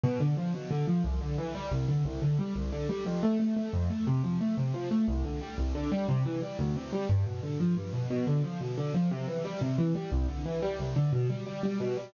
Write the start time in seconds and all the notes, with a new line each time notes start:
0.04 B2
0.20 D3
0.37 F3
0.54 B2
0.71 D3
0.88 F3
1.04 C2
1.21 D3
1.38 E3
1.55 G3
1.71 C2
1.88 D3
2.05 C2
2.22 D3
2.39 G3
2.56 C2
2.72 D3
2.89 G3
3.06 F2
3.23 A3
3.40 A3
3.56 A3
3.73 F2
3.90 A3
4.07 C3
4.24 F3
4.41 A3
4.57 C3
4.74 F3
4.91 A3
5.08 C2
5.25 D3
5.41 G3
5.58 C2
5.75 D3
5.92 G3
6.09 C3
6.25 E3
6.42 G3
6.59 D2
6.76 C3
6.93 G3
7.09 G2
7.26 B2
7.43 D3
7.60 F3
7.77 G2
7.93 B2
8.10 B2
8.27 D3
8.44 F3
8.61 B2
8.77 D3
8.94 F3
9.11 C3
9.28 E3
9.45 G3
9.61 C3
9.78 E3
9.95 G3
10.12 C2
10.29 D3
10.45 E3
10.62 G3
10.79 C2
10.96 D3
11.13 B2
11.30 G3
11.46 G3
11.63 G3
11.80 B2
11.97 G3